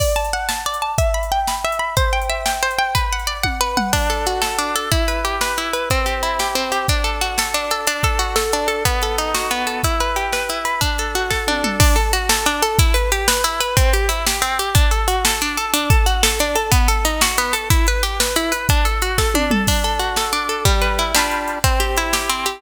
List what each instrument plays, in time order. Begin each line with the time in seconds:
0.00 orchestral harp D5, kick, crash
0.16 orchestral harp A5
0.25 closed hi-hat
0.33 orchestral harp F#5
0.49 orchestral harp A5, snare
0.66 orchestral harp D5
0.74 closed hi-hat
0.82 orchestral harp A5
0.98 orchestral harp E5, kick, closed hi-hat
1.14 orchestral harp B5
1.23 closed hi-hat
1.32 orchestral harp G5
1.47 orchestral harp B5, snare
1.64 orchestral harp E5
1.72 closed hi-hat
1.79 orchestral harp B5
1.97 orchestral harp C5, kick, closed hi-hat
2.13 orchestral harp G5
2.22 closed hi-hat
2.30 orchestral harp E5
2.46 orchestral harp G5, snare
2.63 orchestral harp C5
2.71 closed hi-hat
2.78 orchestral harp G5
2.95 orchestral harp B4, kick, closed hi-hat
3.13 orchestral harp F#5
3.19 closed hi-hat
3.27 orchestral harp D5
3.43 orchestral harp F#5, kick, high tom
3.61 orchestral harp B4
3.77 orchestral harp F#5, mid tom
3.93 orchestral harp D4, kick, crash
4.10 orchestral harp A4, closed hi-hat
4.26 orchestral harp F#4, closed hi-hat
4.42 orchestral harp A4, snare
4.59 orchestral harp D4, closed hi-hat
4.76 orchestral harp A4, closed hi-hat
4.92 orchestral harp E4, kick, closed hi-hat
5.08 orchestral harp B4, closed hi-hat
5.25 orchestral harp G4, closed hi-hat
5.41 orchestral harp B4, snare
5.57 orchestral harp E4, closed hi-hat
5.73 orchestral harp B4, closed hi-hat
5.90 orchestral harp C4, kick, closed hi-hat
6.06 orchestral harp G4, closed hi-hat
6.23 orchestral harp E4, closed hi-hat
6.39 orchestral harp G4, snare
6.55 orchestral harp C4, closed hi-hat
6.72 orchestral harp G4, closed hi-hat
6.88 orchestral harp D4, kick, closed hi-hat
7.04 orchestral harp A4, closed hi-hat
7.21 orchestral harp F#4, closed hi-hat
7.38 orchestral harp A4, snare
7.54 orchestral harp D4, closed hi-hat
7.71 orchestral harp A4, closed hi-hat
7.87 orchestral harp D4, closed hi-hat
8.03 orchestral harp A4, kick, closed hi-hat
8.19 orchestral harp F#4, closed hi-hat
8.36 orchestral harp A4, snare
8.52 orchestral harp D4, closed hi-hat
8.68 orchestral harp A4, closed hi-hat
8.85 orchestral harp B3, kick, closed hi-hat
9.02 orchestral harp A4, closed hi-hat
9.18 orchestral harp D#4, closed hi-hat
9.34 orchestral harp F#4, snare
9.50 orchestral harp B3, closed hi-hat
9.67 orchestral harp A4, closed hi-hat
9.83 orchestral harp E4, kick, closed hi-hat
10.00 orchestral harp B4, closed hi-hat
10.16 orchestral harp G4, closed hi-hat
10.33 orchestral harp B4, snare
10.49 orchestral harp E4, closed hi-hat
10.65 orchestral harp B4, closed hi-hat
10.81 orchestral harp D4, kick, closed hi-hat
10.98 orchestral harp A4, closed hi-hat
11.15 orchestral harp F#4, closed hi-hat
11.30 orchestral harp A4, kick, snare
11.47 orchestral harp D4, high tom
11.64 orchestral harp A4, mid tom
11.80 orchestral harp D4, kick, crash
11.96 orchestral harp A4, closed hi-hat
12.13 orchestral harp F#4, closed hi-hat
12.29 orchestral harp A4, snare
12.46 orchestral harp D4, closed hi-hat
12.62 orchestral harp A4, closed hi-hat
12.79 orchestral harp E4, kick, closed hi-hat
12.94 orchestral harp B4, closed hi-hat
13.12 orchestral harp G4, closed hi-hat
13.28 orchestral harp B4, snare
13.44 orchestral harp E4, closed hi-hat
13.60 orchestral harp B4, closed hi-hat
13.77 orchestral harp C4, kick, closed hi-hat
13.93 orchestral harp G4, closed hi-hat
14.09 orchestral harp E4, closed hi-hat
14.27 orchestral harp G4, snare
14.42 orchestral harp C4, closed hi-hat
14.59 orchestral harp G4, closed hi-hat
14.75 orchestral harp D4, kick, closed hi-hat
14.91 orchestral harp A4, closed hi-hat
15.08 orchestral harp F#4, closed hi-hat
15.25 orchestral harp A4, snare
15.41 orchestral harp D4, closed hi-hat
15.57 orchestral harp A4, closed hi-hat
15.73 orchestral harp D4, closed hi-hat
15.90 orchestral harp A4, kick, closed hi-hat
16.06 orchestral harp F#4, closed hi-hat
16.23 orchestral harp A4, snare
16.39 orchestral harp D4, closed hi-hat
16.55 orchestral harp A4, closed hi-hat
16.72 orchestral harp B3, kick, closed hi-hat
16.88 orchestral harp A4, closed hi-hat
17.05 orchestral harp D#4, closed hi-hat
17.21 orchestral harp F#4, snare
17.38 orchestral harp B3, closed hi-hat
17.53 orchestral harp A4, closed hi-hat
17.70 orchestral harp E4, kick, closed hi-hat
17.87 orchestral harp B4, closed hi-hat
18.03 orchestral harp G4, closed hi-hat
18.20 orchestral harp B4, snare
18.36 orchestral harp E4, closed hi-hat
18.52 orchestral harp B4, closed hi-hat
18.69 orchestral harp D4, kick, closed hi-hat
18.85 orchestral harp A4, closed hi-hat
19.02 orchestral harp F#4, closed hi-hat
19.18 orchestral harp A4, kick, snare
19.34 orchestral harp D4, high tom
19.51 orchestral harp A4, mid tom
19.67 orchestral harp D4, kick, crash
19.84 orchestral harp A4, closed hi-hat
19.99 orchestral harp F#4, closed hi-hat
20.16 orchestral harp A4, snare
20.33 orchestral harp D4, closed hi-hat
20.49 orchestral harp A4, closed hi-hat
20.65 orchestral harp G3, kick, closed hi-hat
20.81 orchestral harp B4, closed hi-hat
20.98 orchestral harp E4, closed hi-hat
21.14 orchestral harp G3 D4 F4, snare
21.19 orchestral harp B4
21.31 closed hi-hat
21.48 closed hi-hat
21.64 orchestral harp C4, kick, closed hi-hat
21.80 orchestral harp G4, closed hi-hat
21.97 orchestral harp E4, closed hi-hat
22.13 orchestral harp G4, snare
22.29 orchestral harp C4, closed hi-hat
22.46 orchestral harp G4, closed hi-hat